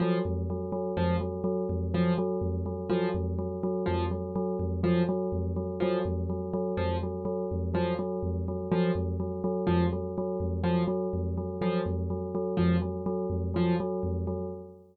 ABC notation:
X:1
M:2/4
L:1/8
Q:1/4=124
K:none
V:1 name="Tubular Bells" clef=bass
_G, F,, G, G, | F,, _G, G, F,, | _G, G, F,, G, | _G, F,, G, G, |
F,, _G, G, F,, | _G, G, F,, G, | _G, F,, G, G, | F,, _G, G, F,, |
_G, G, F,, G, | _G, F,, G, G, | F,, _G, G, F,, | _G, G, F,, G, |
_G, F,, G, G, | F,, _G, G, F,, | _G, G, F,, G, |]
V:2 name="Acoustic Grand Piano" clef=bass
F, z3 | F, z3 | F, z3 | F, z3 |
F, z3 | F, z3 | F, z3 | F, z3 |
F, z3 | F, z3 | F, z3 | F, z3 |
F, z3 | F, z3 | F, z3 |]